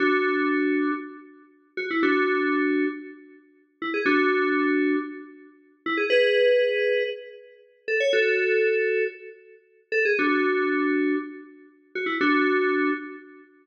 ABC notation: X:1
M:4/4
L:1/16
Q:1/4=118
K:F#m
V:1 name="Electric Piano 2"
[DF]8 z6 F E | [DF]8 z6 E G | [DF]8 z6 E G | [GB]8 z6 A c |
[FA]8 z6 A G | [DF]8 z6 F E | [DF]6 z10 |]